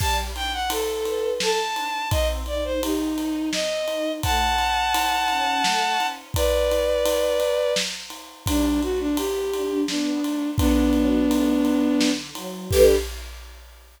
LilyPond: <<
  \new Staff \with { instrumentName = "Violin" } { \time 3/4 \key g \lydian \tempo 4 = 85 a''16 r16 g''16 fis''16 a'4 a''4 | ees''16 r16 d''16 c''16 ees'4 ees''4 | <fis'' a''>2. | <b' d''>2 r4 |
d'8 fis'16 d'16 g'4 d'4 | <b d'>2~ <b d'>8 r8 | g'4 r2 | }
  \new Staff \with { instrumentName = "String Ensemble 1" } { \time 3/4 \key g \lydian g8 d'8 a'8 b'8 a'8 d'8 | c'8 ees'8 g'8 ees'8 c'8 ees'8 | a8 cis'8 e'8 cis'8 a8 cis'8 | r2. |
g8 a8 b8 d'8 b8 a8 | d8 fis8 a8 fis8 d8 fis8 | <g d' a' b'>4 r2 | }
  \new DrumStaff \with { instrumentName = "Drums" } \drummode { \time 3/4 <cymc bd>8 cymr8 cymr8 cymr8 sn8 cymr8 | <bd cymr>8 cymr8 cymr8 cymr8 sn8 cymr8 | <bd cymr>8 cymr8 cymr8 cymr8 sn8 cymr8 | <bd cymr>8 cymr8 cymr8 cymr8 sn8 cymr8 |
<bd cymr>8 cymr8 cymr8 cymr8 sn8 cymr8 | <bd cymr>8 cymr8 cymr8 cymr8 sn8 cymr8 | <cymc bd>4 r4 r4 | }
>>